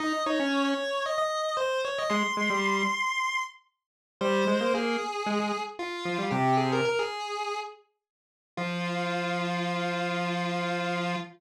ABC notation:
X:1
M:4/4
L:1/16
Q:1/4=114
K:Fm
V:1 name="Lead 1 (square)"
e2 d3 d3 e e3 c2 d e | c'10 z6 | c4 A8 F4 | "^rit." G2 A B B A5 z6 |
F16 |]
V:2 name="Lead 1 (square)"
E z E D3 z10 | A, z A, G,3 z10 | G,2 A, B, B,2 z2 A, A, z4 F, G, | "^rit." C,4 z12 |
F,16 |]